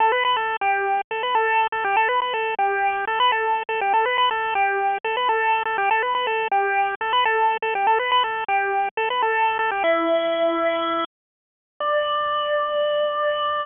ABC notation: X:1
M:4/4
L:1/16
Q:1/4=122
K:D
V:1 name="Lead 1 (square)"
[Aa] [Bb] [Bb] [Aa]2 [Gg]4 [Aa] [Bb] [Aa]3 [Aa] [Gg] | [Aa] [Bb] [Bb] [Aa]2 [Gg]4 [Aa] [Bb] [Aa]3 [Aa] [Gg] | [Aa] [Bb] [Bb] [Aa]2 [Gg]4 [Aa] [Bb] [Aa]3 [Aa] [Gg] | [Aa] [Bb] [Bb] [Aa]2 [Gg]4 [Aa] [Bb] [Aa]3 [Aa] [Gg] |
[Aa] [Bb] [Bb] [Aa]2 [Gg]4 [Aa] [Bb] [Aa]3 [Aa] [Gg] | [Ee]12 z4 | d16 |]